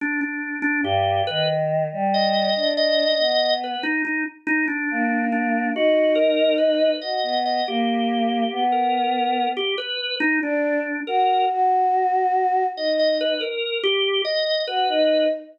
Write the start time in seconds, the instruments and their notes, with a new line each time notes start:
0.01 drawbar organ D4
0.21 drawbar organ D4
0.62 drawbar organ D4
0.83 choir aahs G2, drawbar organ G4
1.27 choir aahs D#3, drawbar organ B4
1.92 choir aahs G3
2.14 drawbar organ D#5
2.56 choir aahs D4
2.77 drawbar organ D#5
3.19 choir aahs B3
3.64 drawbar organ B4
3.83 drawbar organ D#4
4.05 drawbar organ D#4
4.47 drawbar organ D#4
4.68 drawbar organ D4
4.91 choir aahs A#3
5.32 drawbar organ D4
5.75 choir aahs D#4, drawbar organ F#4
6.15 drawbar organ A#4
6.58 drawbar organ B4
7.02 choir aahs F#4, drawbar organ D#5
7.23 choir aahs B3
7.45 drawbar organ D#5
7.67 choir aahs A#3, drawbar organ G4
8.52 choir aahs B3
8.72 drawbar organ A#4
9.57 drawbar organ G4
9.78 drawbar organ B4
10.20 drawbar organ D#4
10.42 choir aahs D4, drawbar organ D4
11.07 choir aahs F#4, drawbar organ A#4
11.49 choir aahs F#4
12.77 choir aahs D#4, drawbar organ D#5
12.99 drawbar organ D#5
13.08 drawbar organ D#5
13.21 drawbar organ B4
13.41 drawbar organ A#4
13.84 drawbar organ G4
14.25 drawbar organ D#5
14.67 choir aahs F#4, drawbar organ B4
14.89 choir aahs D#4